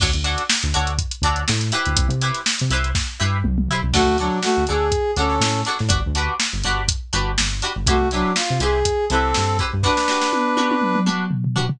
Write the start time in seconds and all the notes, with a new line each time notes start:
0.00 D2 D4 F#4 A4 C#5, kick, crash
0.13 D2, closed hi-hat
0.24 D4 F#4 A4 C#5, closed hi-hat
0.38 closed hi-hat
0.49 snare
0.63 D2, closed hi-hat
0.74 D2 D4 F#4 A4 C#5, closed hi-hat
0.87 closed hi-hat
0.98 kick, closed hi-hat
1.11 closed hi-hat
1.22 D2 D4 F#4 A4 C#5, kick, closed hi-hat
1.36 closed hi-hat
1.48 A2, snare
1.61 snare, closed hi-hat
1.72 E4 G4 B4 C5, closed hi-hat
1.85 D2, closed hi-hat
1.97 C2, kick, closed hi-hat
2.09 C3, closed hi-hat
2.21 E4 G4 B4 C5, closed hi-hat
2.34 snare, closed hi-hat
2.46 snare
2.59 C3, closed hi-hat
2.70 C2 E4 G4 B4 C5, closed hi-hat
2.84 closed hi-hat
2.95 kick, snare
3.19 G2 E4 G4 B4 C5
3.44 C2, mid tom
3.58 mid tom
3.69 E4 G4 B4, floor tom
3.73 C5
3.83 C2
3.93 D2 A3 D4 F#4 A4 C#5, kick, crash
4.06 D2
4.18 F#3 D4 F#4 A4 C#5, closed hi-hat
4.43 A3 F#4, snare
4.56 D2, snare
4.67 D2 D4 F#4 G#4 A4 C#5, closed hi-hat
4.92 kick, closed hi-hat
5.16 D2 C#4 D4 F#4 A4 C#5, closed hi-hat
5.30 snare
5.40 A2, snare
5.65 D4 F#4 A4 C#5, snare, closed hi-hat
5.79 A2, snare
5.89 G1 D4 F#4 G4 B4, kick, closed hi-hat
6.06 D2
6.15 D4 F#4 G4 B4, closed hi-hat
6.40 snare
6.53 G1
6.64 G1 D4 F#4 G4 B4, closed hi-hat
6.88 kick, closed hi-hat
7.13 G1 D4 F#4 G4 B4, closed hi-hat
7.38 G1, snare
7.62 D4 F#4 G4 B4, closed hi-hat
7.76 G1
7.86 C2 A3 E4 F#4 G4 B4 C5, kick, closed hi-hat
8.01 C2
8.11 F#3 D4 E4 G4 B4 C5, snare, closed hi-hat
8.36 F4, snare
8.50 C3
8.60 C2 E4 G4 G#4 B4 C5, snare, closed hi-hat
8.85 kick, closed hi-hat
9.10 C2 C4 E4 G4 A4 B4 C5, closed hi-hat
9.34 G2, snare
9.59 E4 G4 B4 C5, kick, closed hi-hat
9.73 G2
9.83 D4 F#4 G4 B4, kick, snare
9.97 snare
10.08 D4 F#4 G4 B4, snare
10.22 snare
10.33 high tom
10.57 D4 F#4 G4 B4, high tom
10.71 high tom
10.82 mid tom
10.95 mid tom
11.06 D4 F#4 G4 B4, mid tom
11.31 floor tom
11.44 floor tom
11.55 D4 F#4 G4 B4, floor tom
11.69 floor tom